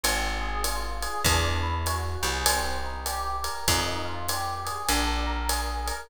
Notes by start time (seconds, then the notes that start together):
0.04 G#1 C4, ride
0.41 G#4
0.64 F4, hi-hat pedal, ride
1.02 G#4, ride
1.24 E2 D4, kick, ride
1.63 E4
1.86 F#4, hi-hat pedal, ride
2.22 C2 G#4, ride
2.46 C4, ride
2.84 D#4
3.06 G4, hi-hat pedal, ride
3.44 A#4, ride
3.68 F2 D#4, kick, ride
4.05 F4
4.29 G4, hi-hat pedal, ride
4.65 G#4, ride
4.89 A#1 D4, ride
5.27 A#4
5.49 G#4, hi-hat pedal, ride
5.86 A#4, ride